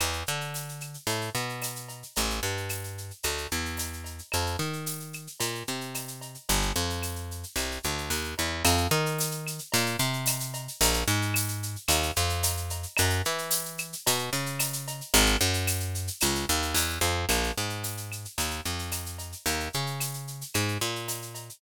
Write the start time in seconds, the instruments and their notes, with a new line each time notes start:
0.00 electric bass (finger) E2, cowbell, claves, shaker
0.13 shaker
0.26 electric bass (finger) D3, shaker
0.41 shaker
0.54 tambourine, shaker
0.69 shaker
0.81 claves, shaker
0.94 shaker
1.07 electric bass (finger) A2, cowbell, shaker
1.21 shaker
1.35 electric bass (finger) B2, shaker
1.49 shaker
1.62 tambourine, cowbell, claves, shaker
1.76 shaker
1.88 cowbell, shaker
2.03 shaker
2.16 electric bass (finger) A1, cowbell, shaker
2.30 shaker
2.43 electric bass (finger) G2, shaker
2.57 shaker
2.69 tambourine, claves, shaker
2.84 shaker
2.98 shaker
3.11 shaker
3.23 electric bass (finger) D2, cowbell, claves, shaker
3.38 shaker
3.51 electric bass (finger) E2, shaker
3.65 shaker
3.77 tambourine, cowbell, shaker
3.93 shaker
4.04 cowbell, shaker
4.18 shaker
4.32 electric bass (finger) F2, cowbell, claves, shaker
4.46 shaker
4.59 electric bass (finger) D#3, shaker
4.73 shaker
4.86 tambourine, shaker
5.00 shaker
5.13 claves, shaker
5.27 shaker
5.40 electric bass (finger) A#2, cowbell, shaker
5.55 shaker
5.67 electric bass (finger) C3, shaker
5.81 shaker
5.94 tambourine, cowbell, claves, shaker
6.08 shaker
6.21 cowbell, shaker
6.34 shaker
6.49 electric bass (finger) G1, cowbell, shaker
6.62 shaker
6.76 electric bass (finger) F2, shaker
6.90 shaker
7.02 tambourine, claves, shaker
7.16 shaker
7.31 shaker
7.43 shaker
7.56 electric bass (finger) C2, cowbell, claves, shaker
7.71 shaker
7.83 electric bass (finger) D2, shaker
7.98 shaker
8.10 electric bass (finger) D#2, tambourine, cowbell, shaker
8.24 shaker
8.38 electric bass (finger) E2, cowbell, shaker
8.65 electric bass (finger) F2, cowbell, claves, shaker
8.77 shaker
8.91 electric bass (finger) D#3, shaker
9.06 shaker
9.18 tambourine, shaker
9.31 shaker
9.47 claves, shaker
9.59 shaker
9.72 electric bass (finger) A#2, cowbell, shaker
9.86 shaker
9.99 electric bass (finger) C3, shaker
10.13 shaker
10.26 tambourine, cowbell, claves, shaker
10.40 shaker
10.54 cowbell, shaker
10.68 shaker
10.81 electric bass (finger) A#1, cowbell, shaker
10.94 shaker
11.08 electric bass (finger) G#2, shaker
11.22 shaker
11.34 tambourine, claves, shaker
11.48 shaker
11.63 shaker
11.76 shaker
11.88 electric bass (finger) D#2, cowbell, claves, shaker
12.03 shaker
12.16 electric bass (finger) F2, shaker
12.29 shaker
12.43 tambourine, cowbell, shaker
12.57 shaker
12.70 cowbell, shaker
12.83 shaker
12.97 electric bass (finger) F#2, cowbell, claves, shaker
13.10 shaker
13.25 electric bass (finger) E3, shaker
13.38 shaker
13.51 tambourine, shaker
13.65 shaker
13.78 claves, shaker
13.93 shaker
14.07 electric bass (finger) B2, cowbell, shaker
14.18 shaker
14.33 electric bass (finger) C#3, shaker
14.46 shaker
14.59 tambourine, cowbell, claves, shaker
14.73 shaker
14.87 cowbell, shaker
15.01 shaker
15.14 electric bass (finger) G#1, cowbell, shaker
15.26 shaker
15.40 electric bass (finger) F#2, shaker
15.53 shaker
15.67 tambourine, claves, shaker
15.80 shaker
15.95 shaker
16.07 shaker
16.20 electric bass (finger) C#2, cowbell, claves, shaker
16.35 shaker
16.49 electric bass (finger) D#2, shaker
16.62 shaker
16.74 electric bass (finger) E2, tambourine, cowbell, shaker
16.90 shaker
17.01 electric bass (finger) F2, cowbell, shaker
17.29 electric bass (finger) A#1, cowbell, claves, shaker
17.43 shaker
17.57 electric bass (finger) G#2, shaker
17.69 shaker
17.83 tambourine, shaker
17.97 shaker
18.12 claves, shaker
18.25 shaker
18.38 electric bass (finger) D#2, cowbell, shaker
18.51 shaker
18.65 electric bass (finger) F2, shaker
18.79 shaker
18.92 tambourine, cowbell, claves, shaker
19.06 shaker
19.18 cowbell, shaker
19.32 shaker
19.46 electric bass (finger) D#2, cowbell, shaker
19.60 shaker
19.73 electric bass (finger) C#3, shaker
19.86 shaker
20.00 tambourine, claves, shaker
20.14 shaker
20.27 shaker
20.41 shaker
20.54 electric bass (finger) G#2, cowbell, claves, shaker
20.68 shaker
20.81 electric bass (finger) A#2, shaker
20.96 shaker
21.08 tambourine, cowbell, shaker
21.22 shaker
21.35 cowbell, shaker
21.49 shaker